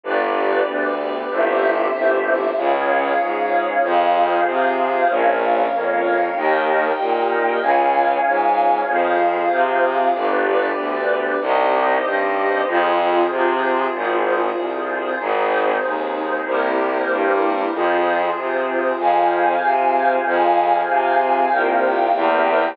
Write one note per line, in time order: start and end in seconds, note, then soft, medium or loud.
0.04 0.60 G1 loud
0.04 1.29 B3 medium
0.04 1.29 D4 medium
0.04 1.29 G4 medium
0.04 1.29 B4 medium
0.04 1.29 D5 medium
0.67 1.24 D2 medium
1.29 1.87 G1 medium
1.29 2.55 C4 medium
1.29 2.55 E4 medium
1.29 2.55 G4 medium
1.29 2.55 C5 medium
1.29 2.55 E5 medium
1.94 2.51 G1 medium
2.56 3.14 C#2 medium
2.56 3.82 C#4 medium
2.56 3.82 F4 medium
2.56 3.81 G#4 medium
2.56 3.82 G#4 medium
2.56 3.81 C#5 medium
2.56 3.81 F5 medium
3.20 3.77 G#2 medium
3.83 4.40 F2 loud
3.83 5.08 C4 medium
3.83 5.08 F4 medium
3.83 5.08 G#4 medium
3.83 5.08 C5 medium
3.83 5.08 F5 medium
4.46 5.03 C3 medium
5.09 5.66 A#1 loud
5.09 6.35 A#3 medium
5.09 6.35 C#4 medium
5.09 6.35 F4 medium
5.09 6.34 A#4 medium
5.09 6.34 C#5 medium
5.09 6.34 F5 medium
5.72 6.29 F2 medium
6.35 6.92 D#2 medium
6.35 7.60 A#3 medium
6.35 7.60 D#4 medium
6.35 7.60 G4 medium
6.35 7.60 A#4 medium
6.35 7.60 D#5 medium
6.35 7.60 G5 medium
6.99 7.56 A#2 medium
7.61 8.18 C#2 medium
7.61 8.87 C#4 medium
7.61 8.87 F4 medium
7.61 8.87 G#4 medium
7.61 8.87 C#5 medium
7.61 8.87 F5 medium
7.61 8.87 G#5 medium
8.25 8.82 G#2 medium
8.88 9.45 F2 medium
8.88 10.13 C4 medium
8.88 10.13 F4 medium
8.88 10.13 G#4 medium
8.88 10.14 G#4 medium
8.88 10.14 C5 medium
8.88 10.14 F5 medium
9.51 10.08 C3 medium
10.14 10.71 G1 medium
10.14 11.40 B3 medium
10.14 11.40 D4 medium
10.14 11.39 G4 medium
10.14 11.40 G4 medium
10.14 11.39 B4 medium
10.14 11.39 D5 medium
10.77 11.34 D2 medium
11.41 11.97 C2 loud
11.41 12.66 C4 medium
11.41 12.66 D#4 medium
11.41 12.66 G4 medium
11.41 12.66 C5 medium
11.41 12.66 D#5 medium
12.05 12.61 G2 medium
12.67 13.24 F2 loud
12.67 13.92 C4 medium
12.67 13.92 F4 medium
12.67 13.92 G#4 medium
12.67 13.92 C5 medium
13.30 13.87 C3 medium
13.93 14.51 G#1 medium
13.93 15.18 C4 medium
13.93 15.18 F4 medium
13.93 15.18 G#4 medium
13.93 15.18 C5 medium
14.56 15.13 C2 medium
15.19 15.77 G#1 loud
15.19 16.45 C4 medium
15.19 16.44 D#4 medium
15.19 16.45 D#4 medium
15.19 16.44 G#4 medium
15.19 16.45 G#4 medium
15.19 16.44 C5 medium
15.83 16.40 D#2 medium
16.46 17.03 C2 medium
16.46 17.71 A#3 medium
16.46 17.71 C4 medium
16.46 17.71 E4 medium
16.46 17.71 G4 medium
16.46 17.71 A#4 medium
16.46 17.71 C5 medium
17.09 17.66 G2 medium
17.72 18.30 F2 medium
17.72 18.98 C4 medium
17.72 18.97 F4 medium
17.72 18.98 F4 medium
17.72 18.97 G#4 medium
17.72 18.98 G#4 medium
17.72 18.97 C5 medium
18.36 18.93 C3 medium
18.98 19.55 F2 medium
18.98 20.24 C4 medium
18.98 20.24 F4 medium
18.98 20.24 G#4 medium
18.98 20.24 C5 medium
18.98 20.24 F5 medium
18.98 20.24 G#5 medium
19.62 20.19 C3 medium
20.25 20.81 F2 medium
20.25 21.50 C4 medium
20.25 21.50 F4 medium
20.25 21.50 G#4 medium
20.25 21.50 C5 medium
20.25 21.50 F5 medium
20.25 21.50 G#5 medium
20.88 21.45 C3 medium
21.51 22.09 C2 medium
21.51 22.14 A#3 medium
21.51 22.14 C4 medium
21.51 22.14 F4 medium
21.51 22.14 G4 medium
21.51 22.14 A#4 medium
21.51 22.14 C5 medium
21.51 22.14 F5 medium
21.51 22.14 G5 medium
22.14 22.73 E2 loud
22.14 22.77 A#3 medium
22.14 22.77 C4 medium
22.14 22.77 E4 medium
22.14 22.77 G4 medium
22.14 22.77 A#4 medium
22.14 22.77 C5 medium
22.14 22.77 E5 medium
22.14 22.77 G5 medium